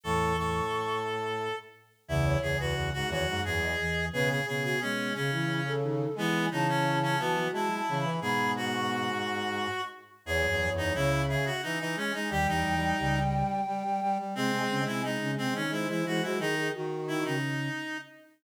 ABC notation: X:1
M:3/4
L:1/16
Q:1/4=88
K:C#m
V:1 name="Flute"
c'6 z6 | e c2 B z2 c z2 d3 | B G2 F z2 G z2 A3 | g2 a6 (3a2 a2 b2 |
b2 z c' c'2 c'4 z2 | c6 e2 e z g2 | =g12 | z g2 g d2 z2 ^B4 |
G G F4 z6 |]
V:2 name="Clarinet"
A2 A8 z2 | E2 G F2 F F2 G4 | G G G G C2 C4 z2 | B,2 D C2 C B,2 E4 |
G2 F8 z2 | G3 D E2 G F D D C D | =G D5 z6 | ^B,3 E D2 B, C E E F E |
D2 z2 E D5 z2 |]
V:3 name="Ocarina"
[E,,E,]4 z8 | [C,,C,]2 [C,,C,]4 [D,,D,] [F,,F,]2 z [E,,E,]2 | [B,,B,]2 [B,,B,]4 [C,C] [E,E]2 z [D,D]2 | [E,E]2 [E,E]4 [F,F] [F,F]2 z [E,E]2 |
[B,,B,]6 z6 | [E,,E,] [F,,F,] [F,,F,]2 [C,,C,]3 z5 | [D,,D,] [E,,E,] [E,,E,]2 [C,,C,]3 z5 | [^B,,^B,] [B,,B,] [C,C] [B,,B,]2 [C,C] [B,,B,] [D,D]2 [E,E] [E,E] [F,F] |
z4 [D,D] [C,C]3 z4 |]
V:4 name="Brass Section" clef=bass
A,,2 A,,8 z2 | E,,2 E,, E,, E,, G,, E,, G,, E,,2 z2 | C,2 C,2 G,2 C,6 | G,2 C,4 E,2 G,2 C, E, |
G,,10 z2 | (3E,,2 E,,2 E,,2 C,4 E, E, G, G, | (3=G,2 G,2 G,2 G,4 G, G, G, G, | (3G,2 G,2 G,2 G,4 G, G, G, G, |
D,2 D,4 z6 |]